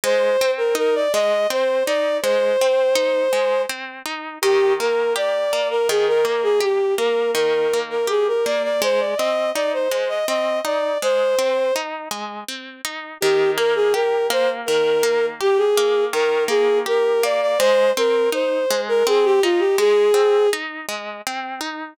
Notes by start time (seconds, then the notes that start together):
0.04 G#3 C5
0.41 C4
0.57 A#4
0.75 D#4 A#4
0.95 D5
1.12 G#3 D#5
1.50 C4 C5
1.86 D#4 D5
2.22 G#3 C5
2.61 C4
2.95 D#4
3.33 G#3
3.69 C4
4.05 D#4
4.42 D#3 G4
4.80 A#3 A#4
5.16 G4 D5
5.53 A#3
5.70 A#4
5.89 D#3 G#4
6.08 A#4
6.25 A#3 A#4
6.43 G#4
6.60 G4
6.98 A#3 A#4
7.35 D#3 A#4
7.73 A#3
7.90 A#4
8.07 G4 G#4
8.28 A#4
8.45 A#3 D5
8.63 D5
8.82 G#3 C5
9.00 D5
9.17 C4 D#5
9.54 D#4 D5
9.73 C5
9.91 G#3 C5
10.08 D#5
10.27 C4 D#5
10.65 D#4 D5
11.02 G#3 C5
11.39 C4
11.76 D#4
12.11 G#3
12.48 C4
12.85 D#4
13.21 D#3 G4
13.57 A#3 A#4
13.75 G#4
13.94 G4 A#4
14.30 A#3 C5
14.66 D#3 A#4
15.03 A#3
15.41 G4
15.57 G#4
15.77 A#3
16.13 D#3 A#4
16.48 A#3 G#4
16.86 G4 A#4
17.23 A#3 D5
17.41 D5
17.59 G#3 C5
17.97 C4 A#4
18.32 D#4 C5
18.70 G#3
18.88 A#4
19.07 C4 G#4
19.24 G4
19.43 D#4 F4
19.59 G4
19.78 G#3 G#4
20.14 C4
20.53 D#4
20.89 G#3
21.27 C4
21.61 D#4